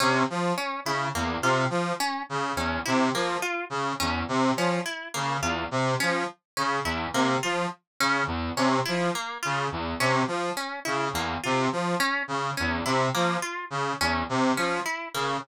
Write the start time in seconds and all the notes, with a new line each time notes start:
0.00 C3 C#4
0.30 F3
0.58 C#4
0.85 C#3 E4
1.15 E2 A#3
1.42 C3 F4
1.70 F3
2.00 C#4
2.29 C#3
2.56 E2 C#4
2.85 C3 E4
3.14 F3 A#3
3.42 F4
3.70 C#3
4.00 E2 C#4
4.28 C3
4.57 F3 C#4
4.85 E4
5.14 C#3 A#3
5.41 E2 F4
5.71 C3
6.00 F3 C#4
6.57 C#3 C#4
6.84 E2 E4
7.13 C3 A#3
7.43 F3 F4
8.00 C#3 C#4
8.27 E2
8.57 C3 C#4
8.85 F3 E4
9.15 A#3
9.43 C#3 F4
9.72 E2
10.00 C3 C#4
10.27 F3
10.57 C#4
10.85 C#3 E4
11.13 E2 A#3
11.43 C3 F4
11.72 F3
12.00 C#4
12.28 C#3
12.57 E2 C#4
12.85 C3 E4
13.14 F3 A#3
13.42 F4
13.70 C#3
14.00 E2 C#4
14.29 C3
14.57 F3 C#4
14.86 E4
15.14 C#3 A#3